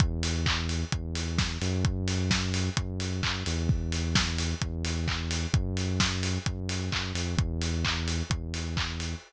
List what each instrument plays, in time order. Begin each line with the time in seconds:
0.00 synth bass 1 E2, kick, closed hi-hat
0.23 open hi-hat
0.46 kick, clap
0.69 open hi-hat
0.92 synth bass 1 E2, kick, closed hi-hat
1.15 open hi-hat
1.38 kick, snare
1.62 synth bass 1 F#2, open hi-hat
1.85 kick, closed hi-hat
2.08 open hi-hat
2.31 kick, snare
2.54 open hi-hat
2.77 synth bass 1 F#2, kick, closed hi-hat
3.00 open hi-hat
3.23 synth bass 1 F#2, kick, clap
3.46 synth bass 1 E2, open hi-hat
3.69 kick
3.92 open hi-hat
4.15 kick, snare
4.38 open hi-hat
4.62 synth bass 1 E2, kick, closed hi-hat
4.85 open hi-hat
5.08 kick, clap
5.31 open hi-hat
5.53 synth bass 1 F#2, kick, closed hi-hat
5.77 open hi-hat
6.00 kick, snare
6.23 open hi-hat
6.46 synth bass 1 F#2, kick, closed hi-hat
6.69 open hi-hat
6.92 synth bass 1 F#2, kick, clap
7.14 synth bass 1 F2, open hi-hat
7.37 synth bass 1 E2, kick, closed hi-hat
7.62 open hi-hat
7.85 kick, clap
8.08 open hi-hat
8.30 synth bass 1 E2, kick, closed hi-hat
8.54 open hi-hat
8.77 kick, clap
9.00 open hi-hat